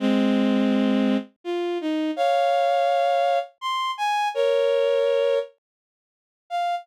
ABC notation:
X:1
M:3/4
L:1/8
Q:1/4=83
K:Fm
V:1 name="Violin"
[A,C]4 F E | [df]4 c' a | [Bd]3 z3 | f2 z4 |]